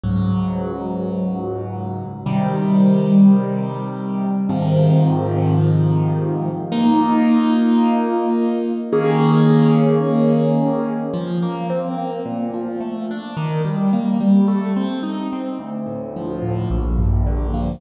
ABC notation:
X:1
M:4/4
L:1/8
Q:1/4=108
K:Ab
V:1 name="Acoustic Grand Piano"
[D,,A,,_G,]8 | [C,E,G,]8 | [A,,C,E,F,]8 | [B,EF]8 |
[E,B,DA]8 | [K:Bb] F, B, C B, B,, F, A, D | E, G, B, G, A, C E C | D,, A,, F, A,, B,,, G,, D, F, |]